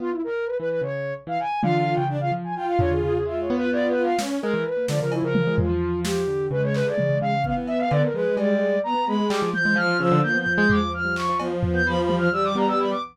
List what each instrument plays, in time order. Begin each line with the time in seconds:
0.00 acoustic grand piano B3, ocarina F4
0.11 ocarina E4
0.24 ocarina A#4
0.46 ocarina B4
0.58 acoustic grand piano E3, ocarina B4
0.70 ocarina B4
0.81 acoustic grand piano C#3, ocarina C#5
1.27 acoustic grand piano E3, ocarina F5
1.40 ocarina G#5
1.62 acoustic grand piano D3, violin F4, ocarina F5, high tom
1.79 ocarina F5
1.94 acoustic grand piano C#3, ocarina G5
2.09 violin D4
2.20 violin F4, ocarina F5
2.31 acoustic grand piano F3
2.44 ocarina G#5
2.55 violin F4, ocarina G5
2.67 ocarina F5
2.79 acoustic grand piano D3, ocarina C#5, floor tom
2.91 acoustic grand piano D3, ocarina G#4
3.03 acoustic grand piano C#3, ocarina G#4
3.13 ocarina G#4
3.25 acoustic grand piano G#3, violin F4, ocarina E5
3.41 ocarina C#5
3.50 acoustic grand piano B3
3.56 ocarina B4
3.71 violin F4, ocarina D5
3.88 ocarina B4
3.95 violin F4
4.03 ocarina F5
4.19 acoustic grand piano B3, violin C#4, snare
4.42 acoustic grand piano G#3, ocarina A#4
4.54 acoustic grand piano E3
4.65 ocarina B4
4.77 acoustic grand piano A#3
4.88 acoustic grand piano D3, violin F3, ocarina D5, snare
5.00 acoustic grand piano C#3, ocarina A#4
5.12 ocarina E4, cowbell
5.23 acoustic grand piano C#3, ocarina A#4
5.35 high tom
5.47 acoustic grand piano G#3
5.58 ocarina F4, floor tom
5.69 acoustic grand piano F3
6.05 ocarina G4, snare
6.27 acoustic grand piano D3
6.51 acoustic grand piano C#3, violin G#3, ocarina B4
6.63 ocarina C#5
6.74 ocarina B4, clap
6.85 acoustic grand piano D3, ocarina D5
6.98 acoustic grand piano C#3, high tom
7.09 acoustic grand piano C#3
7.21 acoustic grand piano C#3, ocarina F5
7.44 violin B3, ocarina F5, kick
7.57 acoustic grand piano E3
7.67 ocarina E5, cowbell
7.79 acoustic grand piano D3, ocarina F5
7.91 acoustic grand piano D3, ocarina D5, cowbell
8.03 ocarina A#4
8.13 acoustic grand piano F3, violin G#3, ocarina B4
8.37 acoustic grand piano G3, ocarina D5, cowbell
8.84 violin B3, ocarina A#5
8.94 acoustic grand piano B3
9.06 violin G#3, ocarina B5
9.20 acoustic grand piano G#3
9.30 acoustic grand piano G3, ocarina D6, clap
9.42 acoustic grand piano F3
9.53 violin F3, ocarina G6, high tom
9.65 acoustic grand piano G#3
9.76 acoustic grand piano F3, violin F3, ocarina F6, cowbell
9.99 acoustic grand piano C#3, violin F3, ocarina E6
10.12 acoustic grand piano D3
10.23 violin F3, acoustic grand piano A#3, ocarina G6
10.34 acoustic grand piano B3
10.39 ocarina G6
10.47 floor tom
10.54 acoustic grand piano G#3, ocarina G6
10.69 violin F3, ocarina D6, floor tom
10.94 ocarina F6
11.05 acoustic grand piano G3
11.16 ocarina C#6, clap
11.29 acoustic grand piano F3
11.39 violin F3, acoustic grand piano B3, cowbell
11.51 acoustic grand piano B3
11.63 floor tom
11.74 acoustic grand piano B3, ocarina G6
11.86 violin F3, ocarina B5
12.01 ocarina B5
12.09 acoustic grand piano G3, high tom
12.17 acoustic grand piano F3, ocarina F6
12.32 violin G3, ocarina E6
12.44 ocarina D6
12.55 acoustic grand piano B3, ocarina A#5
12.68 ocarina E6
12.79 ocarina B5
12.90 ocarina D6